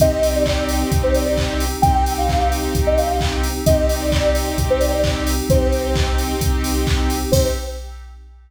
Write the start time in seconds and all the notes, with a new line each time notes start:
0.00 C2 C4 D#4 G4 D#5, kick, closed hi-hat
0.23 open hi-hat
0.35 D5
0.46 kick, clap
0.69 open hi-hat
0.92 C2, kick, closed hi-hat
1.03 C5
1.14 D5, open hi-hat
1.25 D5
1.37 kick, clap
1.60 open hi-hat
1.82 C2 C4 D#4 G4 G5, kick, closed hi-hat
2.06 open hi-hat
2.17 F5
2.29 kick, clap
2.52 open hi-hat
2.75 C2, kick, closed hi-hat
2.87 D#5
2.98 F5, open hi-hat
3.10 F5
3.21 kick, clap
3.44 open hi-hat
3.65 C2 C4 D#4 G4 D#5, kick, closed hi-hat
3.89 open hi-hat
4.01 D5
4.12 kick, clap
4.35 open hi-hat
4.58 C2, kick, closed hi-hat
4.70 C5
4.80 D5, open hi-hat
4.92 D5
5.04 kick, clap
5.27 open hi-hat
5.49 C2 C4 D#4 G4 C5, kick, closed hi-hat
5.73 open hi-hat
5.96 kick, clap
6.18 open hi-hat
6.41 C2, kick, closed hi-hat
6.64 open hi-hat
6.87 kick, clap
7.10 open hi-hat
7.31 C2 C4 D#4 G4 C5, kick, crash